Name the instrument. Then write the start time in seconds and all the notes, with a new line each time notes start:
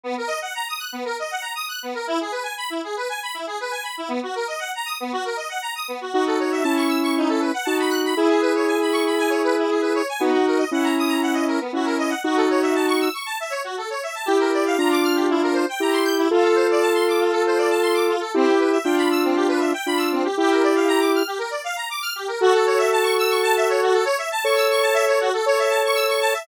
lead 1 (square)
0.03 B3
0.18 A#4
0.27 D#5
0.42 F#5
0.55 A#5
0.68 D#6
0.79 F#6
0.92 B3
1.05 A#4
1.19 D#5
1.31 F#5
1.42 A#5
1.55 D#6
1.69 F#6
1.83 B3
1.94 A#4
2.07 E4
2.21 G#4
2.32 B4
2.43 G#5
2.57 B5
2.70 E4
2.84 G#4
2.97 B4
3.09 G#5
3.23 B5
3.34 E4
3.47 G#4
3.60 B4
3.71 G#5
3.83 B5
3.98 E4
4.08 B3
4.23 F#4
4.35 A#4
4.48 D#5
4.59 F#5
4.75 A#5
4.86 D#6
5.00 B3
5.13 F#4
5.25 A#4
5.37 D#5
5.49 F#5
5.62 A#5
5.75 D#6
5.88 B3
6.01 F#4
6.13 D#4 F#4
6.27 A4
6.40 C#5
6.52 E5
6.63 C#4 E4 A5
6.77 C#6
6.88 E6
7.03 C#6
7.17 D#4
7.29 A4
7.40 B4
7.54 F#5
7.65 D#4 F#4 A5
7.80 B5
7.90 F#6
8.05 B5
8.16 E4 G#4
8.29 G#4
8.41 B4
8.55 C#5
8.67 G#5
8.81 B5
8.92 C#6
9.06 B5
9.18 G#5
9.30 C#5
9.44 B4
9.58 E4
9.70 G#4
9.81 B4
9.95 C#5
10.09 G#5
10.19 B3 D#4 F#4
10.34 F#4
10.47 A#4
10.58 D#5
10.72 C#4 E4 F#5
10.84 A#5
10.99 D#6
11.08 A#5
11.22 F#5
11.34 D#5
11.48 A#4
11.60 B3
11.73 C#4 E4 F#4
11.85 A#4
11.98 D#5
12.09 F#5
12.24 D#4 F#4
12.36 A4
12.50 C#5
12.62 E5
12.75 A5
12.88 C#6
13.00 E6
13.14 C#6
13.26 A5
13.40 E5
13.50 C#5
13.64 F#4
13.78 A4
13.90 C#5
14.03 E5
14.15 A5
14.26 E4 G4
14.40 A#4
14.53 D5
14.66 F5
14.78 D4 F4 A#5
14.91 D6
15.03 F6
15.15 G4
15.30 E4
15.43 A#4
15.53 C5
15.69 G5
15.80 E4 G4 A#5
15.93 C6
16.04 G6
16.18 E4
16.31 F4 A4
16.44 A4
16.55 C5
16.71 D5
16.82 A5
16.94 C6
17.08 D6
17.20 F4
17.31 A4
17.46 C5
17.58 D5
17.70 A5
17.82 C6
17.94 D6
18.09 F4
18.20 A4
18.34 C4 E4 G4
18.48 G4
18.59 B4
18.72 E5
18.84 D4 F4 G5
18.98 B5
19.11 E6
19.24 C4
19.35 G4
19.48 B4
19.59 E5
19.74 G5
19.86 D4 F4 B5
19.97 E6
20.12 C4
20.25 G4
20.38 E4 G4
20.51 A#4
20.63 D5
20.75 F5
20.88 A#5
21.00 D6
21.15 F6
21.27 G4
21.39 A#4
21.50 D5
21.64 F5
21.76 A#5
21.90 D6
22.02 F6
22.16 G4
22.28 A#4
22.41 F#4 A4
22.54 A4
22.66 C#5
22.78 E5
22.92 A5
23.03 C#6
23.18 E6
23.30 C#6
23.43 A5
23.57 E5
23.69 C#5
23.82 F#4
23.93 A4
24.05 C#5
24.18 E5
24.32 A5
24.44 A4 C#5 C#6
24.56 E6
24.70 C#6
24.82 A5
24.94 E5
25.07 C#5
25.21 F#4
25.34 A4
25.46 A4 C#5
25.59 E5
25.70 A5
25.85 C#6
25.95 E6
26.09 C#6
26.21 A5
26.34 E5